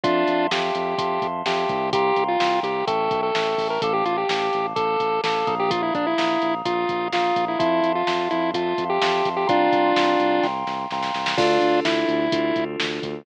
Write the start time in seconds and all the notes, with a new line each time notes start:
0.04 F2 D4 F4 E5 F5 A5 C6, kick, closed hi-hat
0.28 F2, closed hi-hat
0.51 F2 G4 E5 F5 A5 C6, snare
0.75 F2, closed hi-hat
0.98 F2 E5 F5 A5 C6, kick, closed hi-hat
1.22 F2, kick, closed hi-hat
1.46 F2 G4 E5 F5 A5 C6, snare
1.69 C2, kick, closed hi-hat
1.93 G4 F5 G5 A#5 C6, kick, closed hi-hat
2.16 C2, kick, closed hi-hat
2.28 F4
2.40 C2 F5 G5 A#5 C6, snare
2.63 C2 G4, closed hi-hat
2.87 A1 A4 E5 G5 A5 C#6, kick, closed hi-hat
3.11 B1, kick, closed hi-hat
3.23 A4
3.35 A1 E5 G5 A5 C#6, snare
3.58 A1, kick, open hi-hat
3.70 A#4
3.82 A1 A4 F5 A5 D6, kick, closed hi-hat
3.94 G4
4.05 A1 F4, closed hi-hat
4.18 G4
4.29 A1 F5 A5 D6, snare
4.53 A1, closed hi-hat
4.75 A1 A4 F5 A5 D6, kick, closed hi-hat
5.00 A1, kick, closed hi-hat
5.24 A1 A4 F5 A5 D6, snare
5.47 A#1 F5 A#5 D#6, kick, closed hi-hat
5.60 G4
5.71 F4, kick, closed hi-hat
5.83 E4
5.94 A#1 D4, kick, closed hi-hat
6.07 E4
6.18 A#1 F5 A#5 D#6, snare
6.42 A#1, closed hi-hat
6.65 A#1 F4 F5 A#5 D#6, kick, closed hi-hat
6.89 A#1, kick, closed hi-hat
7.12 A#1 F4 F5 A#5 D#6, snare
7.36 A#1, kick, closed hi-hat
7.48 E4
7.59 F2 E4 E5 F5 A5 C6, kick, closed hi-hat
7.83 F2, closed hi-hat
7.95 F4
8.07 F2 E5 F5 A5 C6, snare
8.31 F2 E4, closed hi-hat
8.54 F2 F4 E5 F5 A5 C6, kick, closed hi-hat
8.78 F2, kick, closed hi-hat
8.90 G4
9.01 F2 E5 F5 A5 C6, snare
9.25 F2, kick, closed hi-hat
9.37 G4
9.47 C2 D4 F4 F5 G5 A#5 C6, kick, closed hi-hat
9.72 C2, kick, closed hi-hat
9.96 C2 F5 G5 A#5 C6, snare
10.20 C2, closed hi-hat
10.42 C2 F5 G5 A#5 C6, kick, snare
10.66 C2, snare
10.91 C2 F5 G5 A#5 C6, snare
11.03 snare
11.14 C2, snare
11.26 snare
11.38 D2 D4 F4 A4, kick, crash
11.61 D2, closed hi-hat
11.84 D2 E4, snare
12.09 D2, closed hi-hat
12.32 D2 D4 F4 A4, kick, closed hi-hat
12.56 D2, kick, closed hi-hat
12.80 D2, snare
13.02 D2, kick, closed hi-hat